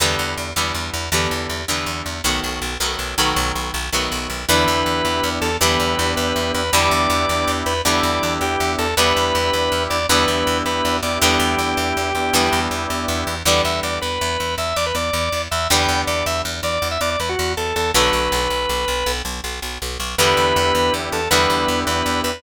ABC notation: X:1
M:12/8
L:1/16
Q:3/8=107
K:Em
V:1 name="Drawbar Organ"
z24 | z24 | B10 A2 B6 B4 B2 | d10 B2 d6 G4 A2 |
B10 d2 B6 B4 d2 | G18 z6 | [K:Bm] d2 e2 d2 B6 e2 d B d6 e2 | g4 d2 e2 z2 d3 e d d B F3 A2 A2 |
B14 z10 | [K:Em] B10 A2 B6 B4 B2 |]
V:2 name="Acoustic Guitar (steel)"
[D,E,G,B,]6 [D,E,G,B,]6 [D,E,G,B,]6 [D,E,G,B,]6 | [^D,F,A,B,]6 [D,F,A,B,]4 [D,F,A,B,]8 [D,F,A,B,]6 | [D,E,G,B,]12 [D,E,G,B,]12 | [D,E,G,B,]12 [D,E,G,B,]12 |
[D,E,G,B,]12 [D,E,G,B,]12 | [D,E,G,B,]12 [D,E,G,B,]12 | [K:Bm] [D,E,G,B,]24 | [D,E,G,B,]24 |
[D,F,A,B,]24 | [K:Em] [D,E,G,B,]12 [D,E,G,B,]12 |]
V:3 name="Drawbar Organ"
z24 | z24 | [B,DEG]12 [B,DEG]12 | [B,DEG]12 [B,DEG]12 |
[B,DEG]12 [B,DEG]10 [B,DEG]2- | [B,DEG]10 [B,DEG]14 | [K:Bm] z24 | z24 |
z24 | [K:Em] [B,DEG]12 [B,DEG]12 |]
V:4 name="Electric Bass (finger)" clef=bass
E,,2 E,,2 E,,2 E,,2 E,,2 E,,2 E,,2 E,,2 E,,2 E,,2 E,,2 E,,2 | B,,,2 B,,,2 B,,,2 B,,,2 B,,,2 B,,,2 B,,,2 B,,,2 B,,,2 B,,,2 B,,,2 B,,,2 | E,,2 E,,2 E,,2 E,,2 E,,2 E,,2 E,,2 E,,2 E,,2 E,,2 E,,2 E,,2 | E,,2 E,,2 E,,2 E,,2 E,,2 E,,2 E,,2 E,,2 E,,2 E,,2 E,,2 E,,2 |
E,,2 E,,2 E,,2 E,,2 E,,2 E,,2 E,,2 E,,2 E,,2 E,,2 E,,2 E,,2 | E,,2 E,,2 E,,2 E,,2 E,,2 E,,2 E,,2 E,,2 E,,2 E,,2 E,,2 E,,2 | [K:Bm] E,,2 E,,2 E,,2 E,,2 E,,2 E,,2 E,,2 E,,2 E,,2 E,,2 E,,2 E,,2 | E,,2 E,,2 E,,2 E,,2 E,,2 E,,2 E,,2 E,,2 E,,2 E,,2 E,,2 E,,2 |
B,,,2 B,,,2 B,,,2 B,,,2 B,,,2 B,,,2 B,,,2 B,,,2 B,,,2 B,,,2 B,,,2 B,,,2 | [K:Em] E,,2 E,,2 E,,2 E,,2 E,,2 E,,2 E,,2 E,,2 E,,2 E,,2 E,,2 E,,2 |]